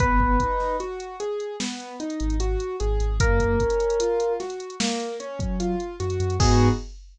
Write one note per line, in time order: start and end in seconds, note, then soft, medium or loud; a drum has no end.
0.00 0.37 G#1 medium
0.00 0.36 B3 medium
0.00 0.77 B4 loud
0.00 kick loud
0.00 closed hi-hat medium
0.20 kick medium
0.40 0.76 D#4 medium
0.40 kick medium
0.40 closed hi-hat medium
0.60 snare soft
0.80 1.16 F#4 medium
0.80 closed hi-hat medium
1.00 closed hi-hat medium
1.20 1.56 G#4 medium
1.20 closed hi-hat medium
1.40 closed hi-hat medium
1.60 1.96 B3 medium
1.60 snare medium
1.80 closed hi-hat medium
2.00 2.36 D#4 medium
2.00 closed hi-hat medium
2.10 closed hi-hat medium
2.20 2.56 G#1 medium
2.20 closed hi-hat medium
2.30 closed hi-hat medium
2.40 2.76 F#4 medium
2.40 closed hi-hat medium
2.60 closed hi-hat medium
2.80 2.99 G#1 medium
2.80 3.16 G#4 medium
2.80 closed hi-hat medium
3.00 3.19 G#1 medium
3.00 closed hi-hat medium
3.20 3.56 F#2 medium
3.20 3.56 A#3 loud
3.20 4.33 A#4 loud
3.20 kick loud
3.20 closed hi-hat loud
3.40 kick medium
3.40 closed hi-hat medium
3.60 3.96 C#4 medium
3.60 kick medium
3.60 closed hi-hat medium
3.70 closed hi-hat medium
3.80 closed hi-hat medium
3.90 closed hi-hat medium
4.00 4.36 F4 medium
4.00 closed hi-hat loud
4.20 closed hi-hat medium
4.40 4.76 F#4 medium
4.40 snare soft
4.40 closed hi-hat medium
4.50 closed hi-hat medium
4.60 closed hi-hat medium
4.70 closed hi-hat medium
4.80 5.16 A#3 medium
4.80 snare loud
5.00 closed hi-hat medium
5.20 5.56 C#4 medium
5.20 closed hi-hat medium
5.39 5.75 F#3 medium
5.39 kick medium
5.39 closed hi-hat medium
5.60 5.96 F4 medium
5.60 closed hi-hat medium
5.80 closed hi-hat medium
6.00 6.18 F#2 medium
6.00 6.36 F#4 medium
6.00 closed hi-hat medium
6.10 closed hi-hat medium
6.20 6.38 F#2 medium
6.20 closed hi-hat medium
6.30 closed hi-hat medium
6.40 6.69 G#2 loud
6.40 6.68 B3 loud
6.40 6.68 D#4 medium
6.40 6.68 F#4 loud
6.40 6.68 G#4 loud
6.40 kick loud
6.40 crash loud